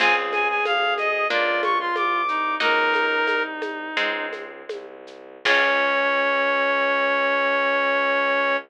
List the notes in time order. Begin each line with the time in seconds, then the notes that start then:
0.00 C#2 C4 F4 G#4 G#5, crash, low conga, shaker
0.32 G#5, high conga, shaker
0.49 G#5
0.65 D2 F5, high conga, shaker
0.98 D#5, high conga, shaker
1.30 C#2 A#3 D4 F4 D5, low conga, shaker
1.63 C#6, high conga, shaker
1.79 F4 C6
1.95 C2 D6, high conga, shaker
2.28 D#4, shaker
2.60 C#2 A#3 D#4 F#4 A#4, low conga, shaker
2.94 high conga, shaker
3.27 C2, high conga, shaker
3.62 high conga, shaker
3.97 C#2 G#3 C4 D#4, low conga, shaker
4.33 high conga, shaker
4.69 C2, high conga, shaker
5.07 shaker
5.45 C#2 C#4 F4 G#4 C#5, kick, crash